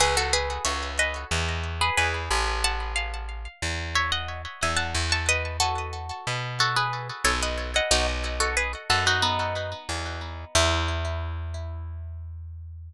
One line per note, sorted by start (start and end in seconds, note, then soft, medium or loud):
0.00 0.59 C#2 medium
0.00 0.16 G#4 loud
0.00 0.16 B4 loud
0.17 0.33 F#4 medium
0.17 0.33 A4 loud
0.33 0.63 G#4 loud
0.33 0.63 B4 loud
0.65 1.25 C#2 medium
0.65 0.93 C#5 medium
0.65 0.93 E5 loud
0.99 1.27 B4 loud
0.99 1.27 D#5 loud
1.31 1.90 E2 medium
1.81 1.97 G#4 medium
1.81 1.97 B4 loud
1.97 2.29 E2 medium
1.97 2.45 G#4 loud
1.97 2.45 B4 loud
2.31 3.48 A1 medium
2.64 2.92 F#5 loud
2.64 2.92 A5 loud
2.96 3.75 F5 loud
3.62 4.46 E2 medium
3.95 4.11 C#5 loud
3.95 4.11 E5 loud
4.12 4.41 D#5 medium
4.12 4.41 F#5 loud
4.62 4.94 E2 medium
4.62 4.78 E5 medium
4.62 4.78 G#5 loud
4.77 5.06 F#5 medium
4.77 5.06 A5 loud
4.95 6.12 E2 medium
5.12 5.28 A5 medium
5.12 5.28 C#6 loud
5.29 5.57 B4 loud
5.29 5.57 D#5 loud
5.60 6.47 F#4 medium
5.60 6.47 A4 loud
6.27 7.11 B2 medium
6.60 6.76 F#4 loud
6.60 6.76 A4 loud
6.76 7.08 G#4 medium
6.76 7.08 B4 medium
7.24 7.80 B1 medium
7.24 7.40 A4 loud
7.24 7.40 C#5 loud
7.42 7.71 B4 medium
7.42 7.71 D#5 medium
7.76 7.92 D#5 medium
7.76 7.92 F#5 loud
7.91 8.75 B1 medium
7.91 8.07 D#4 loud
7.91 8.07 F#4 loud
8.40 8.56 F#4 medium
8.40 8.56 A4 loud
8.57 8.72 G#4 medium
8.57 8.72 B4 loud
8.90 9.74 F#2 medium
8.90 9.05 F#4 loud
8.90 9.05 A4 loud
9.07 9.22 D#4 loud
9.07 9.23 F#4 loud
9.22 10.18 B3 medium
9.22 10.18 D#4 medium
9.89 10.45 E2 medium
10.55 12.93 E2 loud
10.55 12.93 E4 loud